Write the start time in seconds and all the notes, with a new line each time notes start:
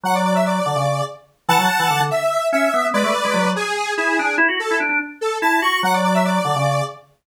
0.04 F#3 F#5
0.14 D5
0.25 D5
0.35 E5
0.46 D5
0.66 D3
0.76 C#3
1.48 E3 F#5 A5
1.59 F#3
1.79 E3
1.90 D3
2.00 D3
2.11 E5
2.52 C#4 E5
2.74 B3
2.93 G#3 B4 D5
3.04 A3
3.25 G#3
3.34 F#3
3.44 F#3
3.56 G#4
3.97 E4 G#4
4.19 D4
4.38 E4
4.48 F#4
4.59 A4
4.71 E4
4.80 D4
4.89 D4
5.21 A4
5.42 E4 A5
5.62 F#4 C#6
5.83 F#3 F#5
5.93 D5
6.04 D5
6.14 E5
6.25 D5
6.45 D3
6.56 C#3